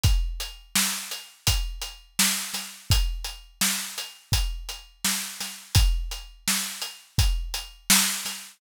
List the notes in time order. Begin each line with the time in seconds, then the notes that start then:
0.03 kick, closed hi-hat
0.40 closed hi-hat
0.75 snare
1.11 closed hi-hat
1.47 kick, closed hi-hat
1.81 closed hi-hat
2.19 snare
2.54 snare, closed hi-hat
2.90 kick, closed hi-hat
3.24 closed hi-hat
3.61 snare
3.98 closed hi-hat
4.32 kick, closed hi-hat
4.69 closed hi-hat
5.04 snare
5.40 snare, closed hi-hat
5.75 kick, closed hi-hat
6.11 closed hi-hat
6.48 snare
6.82 closed hi-hat
7.18 kick, closed hi-hat
7.54 closed hi-hat
7.90 snare
8.25 snare, closed hi-hat